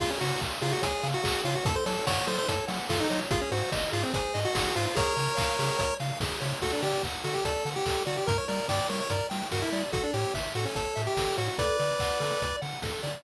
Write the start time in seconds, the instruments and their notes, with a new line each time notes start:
0.00 synth bass 1 C#2, lead 1 (square) F4 G#4, kick, crash
0.10 lead 1 (square) C#4
0.21 synth bass 1 C#3, lead 1 (square) F#4 C#5, open hi-hat
0.40 synth bass 1 C#2, lead 1 (square) F5, kick, clap
0.61 synth bass 1 C#3, lead 1 (square) F4 G#4, open hi-hat
0.72 lead 1 (square) F#4
0.82 synth bass 1 C#2, lead 1 (square) G#4 C#5, kick, closed hi-hat
1.03 synth bass 1 C#3, lead 1 (square) F5, open hi-hat
1.14 lead 1 (square) F#4
1.23 synth bass 1 C#2, lead 1 (square) G#4, kick, clap
1.44 synth bass 1 C#3, lead 1 (square) F4 C#5, open hi-hat
1.55 lead 1 (square) F#4
1.65 synth bass 1 F#2, lead 1 (square) A4, kick, closed hi-hat
1.76 lead 1 (square) C5
1.86 synth bass 1 F#3, lead 1 (square) A4 C#5, open hi-hat
2.07 synth bass 1 F#2, lead 1 (square) C#5 F#5, kick, snare
2.27 synth bass 1 F#3, lead 1 (square) A4 C5, open hi-hat
2.38 lead 1 (square) C5
2.48 synth bass 1 F#2, lead 1 (square) A4 C#5, kick, closed hi-hat
2.68 synth bass 1 F#3, lead 1 (square) F#5, open hi-hat
2.89 synth bass 1 F#2, lead 1 (square) F4 A4, kick, snare
3.00 lead 1 (square) D#4
3.10 synth bass 1 F#3, lead 1 (square) C#5, open hi-hat
3.31 synth bass 1 G#1, lead 1 (square) F4 G#4, kick, closed hi-hat
3.41 lead 1 (square) C#4
3.51 synth bass 1 G#2, lead 1 (square) F#4 C5, open hi-hat
3.72 synth bass 1 G#1, lead 1 (square) D#5, kick, snare
3.92 synth bass 1 G#2, lead 1 (square) F4 G#4, open hi-hat
4.03 lead 1 (square) C4
4.14 synth bass 1 G#1, lead 1 (square) G#4 C5, kick, closed hi-hat
4.34 synth bass 1 G#2, lead 1 (square) D#5, open hi-hat
4.45 lead 1 (square) F#4
4.54 synth bass 1 G#1, lead 1 (square) G#4, kick, snare
4.75 synth bass 1 G#2, lead 1 (square) F4 C5, open hi-hat
4.86 lead 1 (square) F4
4.95 synth bass 1 C#2, lead 1 (square) G#4 A#4 C#5, kick, closed hi-hat
5.16 synth bass 1 C#3, lead 1 (square) C#5, open hi-hat
5.37 synth bass 1 C#2, lead 1 (square) F5, kick, clap
5.59 synth bass 1 C#3, lead 1 (square) G#4, open hi-hat
5.79 synth bass 1 C#2, lead 1 (square) C#5, kick, closed hi-hat
6.00 synth bass 1 C#3, lead 1 (square) F5, open hi-hat
6.20 synth bass 1 C#2, lead 1 (square) G#4, kick, snare
6.41 synth bass 1 C#3, lead 1 (square) C#5, open hi-hat
6.62 synth bass 1 D2, lead 1 (square) F#4 A4, kick, crash
6.73 lead 1 (square) D4
6.82 synth bass 1 D3, lead 1 (square) G4 D5, open hi-hat
7.03 synth bass 1 D2, lead 1 (square) F#5, kick, clap
7.24 synth bass 1 D3, lead 1 (square) F#4 A4, open hi-hat
7.34 lead 1 (square) G4
7.45 synth bass 1 D2, lead 1 (square) A4 D5, kick, closed hi-hat
7.65 synth bass 1 D3, lead 1 (square) F#5, open hi-hat
7.76 lead 1 (square) G4
7.86 synth bass 1 D2, lead 1 (square) A4, kick, clap
8.06 synth bass 1 D3, lead 1 (square) F#4 D5, open hi-hat
8.17 lead 1 (square) G4
8.26 synth bass 1 G2, lead 1 (square) A#4, kick, closed hi-hat
8.38 lead 1 (square) C#5
8.48 synth bass 1 G3, lead 1 (square) A#4 D5, open hi-hat
8.68 synth bass 1 G2, lead 1 (square) D5 G5, kick, snare
8.89 synth bass 1 G3, lead 1 (square) A#4 C#5, open hi-hat
9.00 lead 1 (square) C#5
9.10 synth bass 1 G2, lead 1 (square) A#4 D5, kick, closed hi-hat
9.30 synth bass 1 G3, lead 1 (square) G5, open hi-hat
9.51 synth bass 1 G2, lead 1 (square) F#4 A#4, kick, snare
9.62 lead 1 (square) E4
9.72 synth bass 1 G3, lead 1 (square) D5, open hi-hat
9.92 synth bass 1 A1, lead 1 (square) F#4 A4, kick, closed hi-hat
10.03 lead 1 (square) D4
10.13 synth bass 1 A2, lead 1 (square) G4 C#5, open hi-hat
10.34 synth bass 1 A1, lead 1 (square) E5, kick, snare
10.55 synth bass 1 A2, lead 1 (square) F#4 A4, open hi-hat
10.65 lead 1 (square) C#4
10.75 synth bass 1 A1, lead 1 (square) A4 C#5, kick, closed hi-hat
10.96 synth bass 1 A2, lead 1 (square) E5, open hi-hat
11.07 lead 1 (square) G4
11.17 synth bass 1 A1, lead 1 (square) A4, kick, snare
11.38 synth bass 1 A2, lead 1 (square) F#4 C#5, open hi-hat
11.48 lead 1 (square) F#4
11.58 synth bass 1 D2, lead 1 (square) A4 B4 D5, kick, closed hi-hat
11.79 synth bass 1 D3, lead 1 (square) D5, open hi-hat
11.99 synth bass 1 D2, lead 1 (square) F#5, kick, clap
12.20 synth bass 1 D3, lead 1 (square) A4, open hi-hat
12.42 synth bass 1 D2, lead 1 (square) D5, kick, closed hi-hat
12.62 synth bass 1 D3, lead 1 (square) F#5, open hi-hat
12.82 synth bass 1 D2, lead 1 (square) A4, kick, snare
13.03 synth bass 1 D3, lead 1 (square) D5, open hi-hat